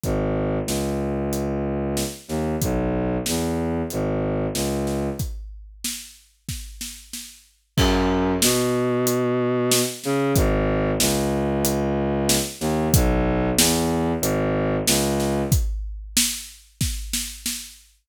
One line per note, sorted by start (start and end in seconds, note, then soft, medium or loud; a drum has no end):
0.03 0.59 G#1 medium
0.03 kick medium
0.03 closed hi-hat medium
0.66 2.03 C#2 medium
0.66 snare medium
1.33 closed hi-hat medium
1.97 snare medium
2.28 2.56 D#2 medium
2.28 snare soft
2.62 3.17 B1 medium
2.62 kick medium
2.62 closed hi-hat loud
3.26 3.82 E2 medium
3.26 snare medium
3.90 4.47 G#1 medium
3.90 closed hi-hat medium
4.54 5.09 C#2 medium
4.54 snare medium
4.87 snare medium
5.19 kick medium
5.19 closed hi-hat medium
5.84 snare medium
6.49 kick medium
6.49 snare medium
6.81 snare medium
7.13 snare medium
7.77 8.32 F#2 loud
7.77 kick loud
7.77 crash loud
8.42 9.80 B2 loud
8.42 snare loud
9.07 closed hi-hat loud
9.72 snare loud
10.04 10.32 C#3 loud
10.04 snare medium
10.35 10.91 G#1 loud
10.35 kick loud
10.35 closed hi-hat loud
11.00 12.37 C#2 medium
11.00 snare loud
11.65 closed hi-hat loud
12.29 snare loud
12.60 12.88 D#2 loud
12.60 snare medium
12.94 13.49 B1 loud
12.94 kick loud
12.94 closed hi-hat loud
13.57 14.12 E2 loud
13.57 snare loud
14.21 14.76 G#1 loud
14.21 closed hi-hat loud
14.87 15.42 C#2 loud
14.87 snare loud
15.20 snare medium
15.52 kick loud
15.52 closed hi-hat loud
16.17 snare loud
16.81 kick medium
16.81 snare medium
17.13 snare loud
17.46 snare medium